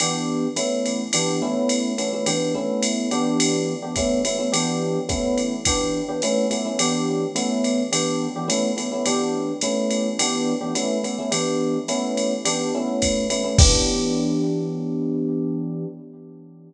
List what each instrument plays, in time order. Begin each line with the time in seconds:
0.00 electric piano 1 E3 B3 D4 G4, ride
0.56 electric piano 1 A3 B3 C#4 E4, hi-hat pedal, ride
0.86 ride
1.13 electric piano 1 E3 B3 D4 G4, ride
1.42 electric piano 1 A3 B3 C#4 E4
1.69 hi-hat pedal, ride
1.98 electric piano 1 A3 B3 C#4 E4, ride
2.13 electric piano 1 A3 B3 C#4 E4
2.26 electric piano 1 E3 B3 D4 G4, ride
2.54 electric piano 1 A3 B3 C#4 E4
2.83 hi-hat pedal, ride
3.11 electric piano 1 E3 B3 D4 G4, ride
3.40 ride
3.82 electric piano 1 E3 B3 D4 G4
3.96 electric piano 1 A3 B3 C#4 E4, kick, hi-hat pedal, ride
4.25 electric piano 1 A3 B3 C#4 E4, ride
4.38 electric piano 1 A3 B3 C#4 E4
4.52 electric piano 1 E3 B3 D4 G4, ride
5.09 electric piano 1 A3 B3 C#4 E4, kick, hi-hat pedal, ride
5.38 ride
5.65 electric piano 1 E3 B3 D4 G4, kick, ride
6.08 electric piano 1 E3 B3 D4 G4
6.22 electric piano 1 A3 B3 C#4 E4, hi-hat pedal, ride
6.50 electric piano 1 A3 B3 C#4 E4, ride
6.65 electric piano 1 A3 B3 C#4 E4
6.79 electric piano 1 E3 B3 D4 G4, ride
7.35 electric piano 1 A3 B3 C#4 E4, hi-hat pedal, ride
7.64 ride
7.92 electric piano 1 E3 B3 D4 G4, ride
8.36 electric piano 1 E3 B3 D4 G4
8.48 electric piano 1 A3 B3 C#4 E4, hi-hat pedal, ride
8.77 electric piano 1 A3 B3 C#4 E4, ride
8.92 electric piano 1 A3 B3 C#4 E4
9.06 electric piano 1 E3 B3 D4 G4, ride
9.61 electric piano 1 A3 B3 C#4 E4, hi-hat pedal, ride
9.91 ride
10.19 electric piano 1 E3 B3 D4 G4, ride
10.61 electric piano 1 E3 B3 D4 G4
10.75 electric piano 1 A3 B3 C#4 E4, hi-hat pedal, ride
11.03 electric piano 1 A3 B3 C#4 E4, ride
11.19 electric piano 1 A3 B3 C#4 E4
11.31 electric piano 1 E3 B3 D4 G4, ride
11.88 electric piano 1 A3 B3 C#4 E4, hi-hat pedal, ride
12.17 ride
12.45 electric piano 1 E3 B3 D4 G4, ride
12.75 electric piano 1 A3 B3 C#4 E4
13.02 kick, hi-hat pedal, ride
13.30 electric piano 1 A3 B3 C#4 E4, ride
13.44 electric piano 1 A3 B3 C#4 E4
13.58 electric piano 1 E3 B3 D4 G4, kick, crash